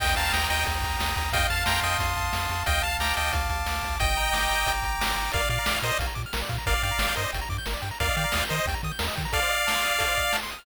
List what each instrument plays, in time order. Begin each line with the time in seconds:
0.00 synth bass 1 D#2, lead 1 (square) D#5 G5, kick, crash
0.16 synth bass 1 D#2, lead 1 (square) F5 A5 A#5, closed hi-hat
0.33 synth bass 1 D#2, lead 1 (square) G5 A#5 D#6, snare
0.50 synth bass 1 D#2, lead 1 (square) D#5 G5 A#5, closed hi-hat
0.66 synth bass 1 D#2, lead 1 (square) G5, kick, closed hi-hat
0.82 synth bass 1 D#2, lead 1 (square) A#5, kick, closed hi-hat
0.99 synth bass 1 D#2, lead 1 (square) D#6, snare
1.16 synth bass 1 D#2, lead 1 (square) A#5, kick, closed hi-hat
1.32 synth bass 1 F2, lead 1 (square) D#5 F5 G5, kick, closed hi-hat
1.50 synth bass 1 F2, lead 1 (square) F5 A5, closed hi-hat
1.66 synth bass 1 F2, lead 1 (square) G5 A#5 C6, snare
1.83 synth bass 1 F2, lead 1 (square) D#5 G5 D#6, closed hi-hat
1.99 synth bass 1 F2, lead 1 (square) C6, kick, closed hi-hat
2.16 synth bass 1 F2, lead 1 (square) A5, kick, closed hi-hat
2.33 synth bass 1 F2, lead 1 (square) F5, snare
2.49 synth bass 1 F2, lead 1 (square) A5, closed hi-hat
2.66 synth bass 1 D2, lead 1 (square) D#5 F5 G5, kick, closed hi-hat
2.82 synth bass 1 D2, lead 1 (square) F5 A5, closed hi-hat
2.99 synth bass 1 D2, lead 1 (square) G5 A#5 D6, snare
3.15 synth bass 1 D2, lead 1 (square) D#5 G5 A5, closed hi-hat
3.33 synth bass 1 D2, lead 1 (square) F5, kick, closed hi-hat
3.49 synth bass 1 D2, lead 1 (square) A5, kick, closed hi-hat
3.66 synth bass 1 D2, lead 1 (square) D6, snare
3.82 synth bass 1 D2, lead 1 (square) A5, kick, closed hi-hat
4.00 synth bass 1 G1, lead 1 (square) D#5 G5, kick, closed hi-hat
4.15 synth bass 1 G1, lead 1 (square) A#5, closed hi-hat
4.33 synth bass 1 G1, lead 1 (square) D6, snare
4.49 synth bass 1 G1, lead 1 (square) A#5, closed hi-hat
4.66 synth bass 1 G1, lead 1 (square) G5, kick, closed hi-hat
4.82 synth bass 1 G1, lead 1 (square) A#5, kick, closed hi-hat
4.99 synth bass 1 G1, lead 1 (square) D6, snare
5.16 synth bass 1 G1, lead 1 (square) A#5, closed hi-hat
5.32 synth bass 1 A#1, lead 1 (square) A#4 D5 F5, kick, closed hi-hat
5.40 lead 1 (square) D5
5.49 synth bass 1 A#2, lead 1 (square) D5 F5, closed hi-hat
5.59 lead 1 (square) A#5
5.66 synth bass 1 A#1, lead 1 (square) D6, snare
5.76 lead 1 (square) F6
5.82 synth bass 1 A#2, lead 1 (square) A#4 C5 D#5, closed hi-hat
5.92 lead 1 (square) D5
5.99 synth bass 1 A#1, lead 1 (square) F5, kick, closed hi-hat
6.07 lead 1 (square) A#5
6.15 synth bass 1 A#2, lead 1 (square) D6, kick, closed hi-hat
6.26 lead 1 (square) F6
6.33 synth bass 1 A#1, lead 1 (square) A#4, snare
6.42 lead 1 (square) D5
6.49 synth bass 1 A#2, lead 1 (square) F5, kick, closed hi-hat
6.58 lead 1 (square) A#5
6.66 synth bass 1 G1, lead 1 (square) A#4 D5 F5, kick, closed hi-hat
6.74 lead 1 (square) D5
6.83 synth bass 1 G2, lead 1 (square) D5 F5 G5, closed hi-hat
6.91 lead 1 (square) A#5
6.99 synth bass 1 G1, lead 1 (square) D6, snare
7.09 lead 1 (square) G6
7.15 synth bass 1 G2, lead 1 (square) A#4 C5 D#5, closed hi-hat
7.23 lead 1 (square) D5
7.33 synth bass 1 G1, lead 1 (square) G5, kick, closed hi-hat
7.41 lead 1 (square) A#5
7.49 synth bass 1 G2, lead 1 (square) D6, kick, closed hi-hat
7.58 lead 1 (square) G6
7.66 synth bass 1 G1, lead 1 (square) A#4, snare
7.74 lead 1 (square) D5
7.82 synth bass 1 G2, lead 1 (square) G5, closed hi-hat
7.91 lead 1 (square) A#5
8.00 synth bass 1 D#2, lead 1 (square) A#4 D5 F5, kick, closed hi-hat
8.09 lead 1 (square) D#5
8.16 synth bass 1 D#3, lead 1 (square) D5 F5 G5, closed hi-hat
8.24 lead 1 (square) A#5
8.32 synth bass 1 D#2, lead 1 (square) D#6, snare
8.42 lead 1 (square) G6
8.48 synth bass 1 D#3, lead 1 (square) A#4 C5 D#5, closed hi-hat
8.59 lead 1 (square) D#5
8.66 synth bass 1 D#2, lead 1 (square) G5, kick, closed hi-hat
8.74 lead 1 (square) A#5
8.83 synth bass 1 D#3, lead 1 (square) D#6, kick, closed hi-hat
8.92 lead 1 (square) G6
8.99 synth bass 1 D#2, lead 1 (square) A#4, snare
9.08 lead 1 (square) D#5
9.15 synth bass 1 D#3, lead 1 (square) G5, kick, closed hi-hat
9.25 lead 1 (square) A#5
9.32 lead 1 (square) A4 D5 F5, kick, closed hi-hat
9.42 lead 1 (square) C5
9.49 lead 1 (square) D#5, closed hi-hat
9.59 lead 1 (square) F5
9.67 lead 1 (square) A5, snare
9.75 lead 1 (square) C6
9.82 lead 1 (square) D#6, closed hi-hat
9.93 lead 1 (square) F6
9.99 lead 1 (square) A4, kick, closed hi-hat
10.08 lead 1 (square) C5
10.16 lead 1 (square) D#5, kick, closed hi-hat
10.24 lead 1 (square) F5
10.33 lead 1 (square) A5, snare
10.43 lead 1 (square) C6
10.51 lead 1 (square) D#6, closed hi-hat
10.59 lead 1 (square) F6